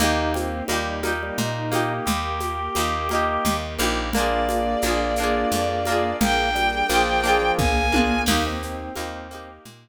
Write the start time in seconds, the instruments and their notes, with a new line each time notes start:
0.00 electric bass (finger) D#2, orchestral harp A#3 D#4 G4, string ensemble 1 A#3 D#4 G4, drawbar organ D#4, low conga, shaker
0.34 drawbar organ C4, high conga, shaker
0.68 electric bass (finger) D#2, drawbar organ G3, orchestral harp A#3 D#4, high conga, shaker
0.72 orchestral harp G4
1.03 orchestral harp A#3 D#4 G4, high conga, shaker
1.23 drawbar organ G3
1.38 electric bass (finger) A#2, drawbar organ D#4, low conga, shaker
1.72 orchestral harp A#3 D#4 G4, high conga, shaker
2.06 electric bass (finger) D#2, string ensemble 1 A#3 G4 A#4, drawbar organ G4, low conga, shaker
2.40 high conga, shaker
2.75 electric bass (finger) D#2, orchestral harp A#3 D#4, high conga, shaker
2.80 orchestral harp G4
3.09 orchestral harp A#3 D#4, high conga, shaker
3.15 orchestral harp G4
3.45 electric bass (finger) D#2, low conga, shaker
3.78 electric bass (finger) A#1, orchestral harp A#3 D#4 G4, high conga, shaker
4.13 string ensemble 1 A#3 D4 F4 G#4, orchestral harp A#3 D4, drawbar organ A#3, violin D5, low conga, shaker
4.18 orchestral harp F4 G#4
4.49 high conga, shaker
4.82 electric bass (finger) A#1, orchestral harp A#3 D4, high conga, shaker
4.86 orchestral harp F4 G#4
5.16 orchestral harp A#3, shaker
5.20 orchestral harp D4 F4 G#4
5.51 electric bass (finger) F2, low conga, shaker
5.85 orchestral harp A#3 D4, high conga, shaker
5.90 orchestral harp F4 G#4
6.20 electric bass (finger) A#1, string ensemble 1 A#3 D4 G#4 A#4, drawbar organ A#3, violin G5, low conga, shaker
6.55 drawbar organ G3, high conga, shaker
6.89 electric bass (finger) A#1, drawbar organ F3, orchestral harp A#3 D4, high conga, shaker
6.93 orchestral harp F4 G#4
7.24 orchestral harp A#3 D4 F4, shaker
7.29 orchestral harp G#4
7.42 drawbar organ F3
7.58 electric bass (finger) A#1, drawbar organ A#3, violin G#5, kick, high tom
7.92 orchestral harp A#3 D4 F4, high tom
7.98 orchestral harp G#4
8.26 electric bass (finger) D#2, string ensemble 1 A#3 D#4 G4, drawbar organ A#3, orchestral harp A#3 D#4, crash, low conga, shaker
8.32 orchestral harp G4
8.46 drawbar organ C4
8.62 drawbar organ C4, shaker
8.96 electric bass (finger) D#2, orchestral harp A#3 D#4, high conga, shaker
9.00 orchestral harp G4
9.31 string ensemble 1 A#3 G4 A#4, orchestral harp A#3 D#4, shaker
9.35 orchestral harp G4
9.65 electric bass (finger) A#2, low conga, shaker